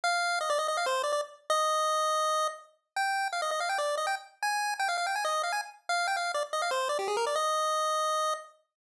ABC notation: X:1
M:4/4
L:1/16
Q:1/4=164
K:Eb
V:1 name="Lead 1 (square)"
f4 e d e e f c2 d d z3 | e12 z4 | g4 f e e f g d2 e g z3 | a4 g f f g a e2 f a z3 |
f2 g f2 d z e f c2 d G A B d | e12 z4 |]